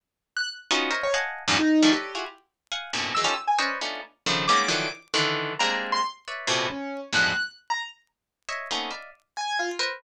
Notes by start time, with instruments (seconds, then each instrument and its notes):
0.37 acoustic grand piano F#6
0.71 orchestral harp B3 C#4 D#4 F4 F#4
0.91 orchestral harp A#4 C5 C#5 D#5 E5
1.03 acoustic grand piano C#5
1.14 orchestral harp D#5 F5 F#5 G#5 A5
1.48 orchestral harp E2 F#2 G2 G#2 A#2
1.59 acoustic grand piano D#4
1.82 orchestral harp D#3 E3 F3 G3 A3
1.92 acoustic grand piano G4, orchestral harp A4 B4 C#5 D5 D#5
2.15 orchestral harp E4 F4 F#4 G#4
2.72 orchestral harp F5 F#5 G#5
2.93 orchestral harp F#2 G2 A2 A#2 B2 C3
3.15 orchestral harp D#3 E3 F#3 G#3, acoustic grand piano E6
3.24 orchestral harp C#4 D#4 F4 G4 A4
3.47 acoustic grand piano G#5
3.59 acoustic grand piano C#4, orchestral harp B4 C5 C#5 D5 D#5
3.81 orchestral harp A3 B3 C#4 D4 D#4 F4
4.26 orchestral harp C#3 D3 D#3 F3
4.48 orchestral harp G3 G#3 A#3 B3 C#4 D#4, acoustic grand piano D6
4.68 orchestral harp D3 D#3 E3 F3 F#3
5.14 orchestral harp D3 D#3 E3
5.59 orchestral harp G3 G#3 A#3 C4 D4, acoustic grand piano A#5
5.92 acoustic grand piano C6
6.28 orchestral harp B4 C#5 D5 E5
6.47 orchestral harp A2 A#2 B2 C3
6.70 acoustic grand piano C#4
7.13 orchestral harp E2 F2 G2 G#2 A2 B2, acoustic grand piano F#6
7.70 acoustic grand piano A#5
8.49 orchestral harp C#5 D#5 E5
8.71 orchestral harp A3 A#3 B3 C4 C#4 D#4
8.91 orchestral harp D5 D#5 E5 F5
9.37 acoustic grand piano G#5
9.59 acoustic grand piano F4
9.79 orchestral harp A#4 B4 C5